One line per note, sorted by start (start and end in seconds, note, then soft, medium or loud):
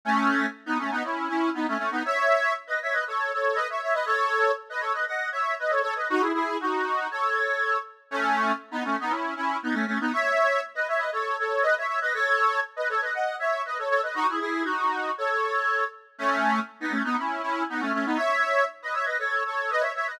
0.05 0.46 A3 loud
0.05 0.46 C#4 loud
0.66 0.78 B3 medium
0.66 0.78 D#4 loud
0.78 0.90 A3 medium
0.78 0.90 C#4 medium
0.91 1.03 B3 medium
0.91 1.03 D#4 loud
1.04 1.28 C#4 medium
1.04 1.28 E4 medium
1.28 1.50 C#4 medium
1.28 1.50 E4 medium
1.54 1.66 B3 medium
1.54 1.66 D#4 medium
1.68 1.77 A3 medium
1.68 1.77 C#4 loud
1.78 1.90 A3 medium
1.78 1.90 C#4 medium
1.91 2.03 B3 medium
1.91 2.03 D#4 loud
2.05 2.53 C#5 loud
2.05 2.53 E5 loud
2.67 2.79 B4 medium
2.67 2.79 D#5 medium
2.82 2.94 C#5 medium
2.82 2.94 E5 medium
2.92 3.04 B4 medium
2.92 3.04 D#5 medium
3.07 3.32 A4 medium
3.07 3.32 C#5 medium
3.33 3.57 A4 medium
3.33 3.57 C#5 medium
3.55 3.67 B4 medium
3.55 3.67 D#5 loud
3.70 3.81 C#5 medium
3.70 3.81 E5 medium
3.82 3.94 C#5 medium
3.82 3.94 E5 medium
3.93 4.05 B4 medium
3.93 4.05 D#5 loud
4.06 4.51 A4 loud
4.06 4.51 C#5 loud
4.70 4.82 B4 medium
4.70 4.82 D#5 medium
4.80 4.92 A4 medium
4.80 4.92 C#5 medium
4.93 5.05 B4 medium
4.93 5.05 D#5 medium
5.07 5.29 D#5 medium
5.07 5.29 F#5 medium
5.32 5.55 C#5 medium
5.32 5.55 E5 medium
5.59 5.71 B4 medium
5.59 5.71 D#5 medium
5.70 5.81 A4 medium
5.70 5.81 C#5 medium
5.82 5.94 A4 medium
5.82 5.94 C#5 loud
5.96 6.08 B4 medium
5.96 6.08 D#5 medium
6.10 6.22 D#4 loud
6.10 6.22 F#4 loud
6.20 6.32 E4 medium
6.20 6.32 G#4 medium
6.34 6.57 E4 medium
6.34 6.57 G#4 loud
6.60 7.07 D#4 medium
6.60 7.07 F#4 medium
7.11 7.77 A4 medium
7.11 7.77 C#5 loud
8.11 8.52 A3 loud
8.11 8.52 C#4 loud
8.71 8.83 B3 medium
8.71 8.83 D#4 loud
8.84 8.96 A3 medium
8.84 8.96 C#4 medium
9.00 9.12 B3 medium
9.00 9.12 D#4 loud
9.10 9.34 C#4 medium
9.10 9.34 E4 medium
9.36 9.57 C#4 medium
9.36 9.57 E4 medium
9.63 9.75 B3 medium
9.63 9.75 D#4 medium
9.73 9.85 A3 medium
9.73 9.85 C#4 loud
9.87 9.99 A3 medium
9.87 9.99 C#4 medium
10.00 10.12 B3 medium
10.00 10.12 D#4 loud
10.13 10.61 C#5 loud
10.13 10.61 E5 loud
10.75 10.87 B4 medium
10.75 10.87 D#5 medium
10.88 11.00 C#5 medium
10.88 11.00 E5 medium
10.98 11.10 B4 medium
10.98 11.10 D#5 medium
11.12 11.37 A4 medium
11.12 11.37 C#5 medium
11.39 11.63 A4 medium
11.39 11.63 C#5 medium
11.63 11.74 B4 medium
11.63 11.74 D#5 loud
11.78 11.87 C#5 medium
11.78 11.87 E5 medium
11.88 12.00 C#5 medium
11.88 12.00 E5 medium
12.01 12.13 B4 medium
12.01 12.13 D#5 loud
12.14 12.60 A4 loud
12.14 12.60 C#5 loud
12.76 12.88 B4 medium
12.76 12.88 D#5 medium
12.89 13.01 A4 medium
12.89 13.01 C#5 medium
13.01 13.13 B4 medium
13.01 13.13 D#5 medium
13.14 13.36 D#5 medium
13.14 13.36 F#5 medium
13.39 13.62 C#5 medium
13.39 13.62 E5 medium
13.66 13.78 B4 medium
13.66 13.78 D#5 medium
13.78 13.89 A4 medium
13.78 13.89 C#5 medium
13.89 14.01 A4 medium
13.89 14.01 C#5 loud
14.03 14.15 B4 medium
14.03 14.15 D#5 medium
14.15 14.27 D#4 loud
14.15 14.27 F#4 loud
14.29 14.39 E4 medium
14.29 14.39 G#4 medium
14.40 14.63 E4 medium
14.40 14.63 G#4 loud
14.64 15.11 D#4 medium
14.64 15.11 F#4 medium
15.18 15.84 A4 medium
15.18 15.84 C#5 loud
16.18 16.60 A3 loud
16.18 16.60 C#4 loud
16.80 16.92 B3 medium
16.80 16.92 D#4 loud
16.91 17.03 A3 medium
16.91 17.03 C#4 medium
17.04 17.16 B3 medium
17.04 17.16 D#4 loud
17.17 17.42 C#4 medium
17.17 17.42 E4 medium
17.42 17.63 C#4 medium
17.42 17.63 E4 medium
17.69 17.81 B3 medium
17.69 17.81 D#4 medium
17.80 17.92 A3 medium
17.80 17.92 C#4 loud
17.93 18.05 A3 medium
17.93 18.05 C#4 medium
18.05 18.17 B3 medium
18.05 18.17 D#4 loud
18.17 18.64 C#5 loud
18.17 18.64 E5 loud
18.82 18.94 B4 medium
18.82 18.94 D#5 medium
18.93 19.05 C#5 medium
18.93 19.05 E5 medium
19.05 19.17 B4 medium
19.05 19.17 D#5 medium
19.19 19.43 A4 medium
19.19 19.43 C#5 medium
19.46 19.70 A4 medium
19.46 19.70 C#5 medium
19.70 19.82 B4 medium
19.70 19.82 D#5 loud
19.80 19.92 C#5 medium
19.80 19.92 E5 medium
19.95 20.07 C#5 medium
19.95 20.07 E5 medium
20.07 20.19 B4 medium
20.07 20.19 D#5 loud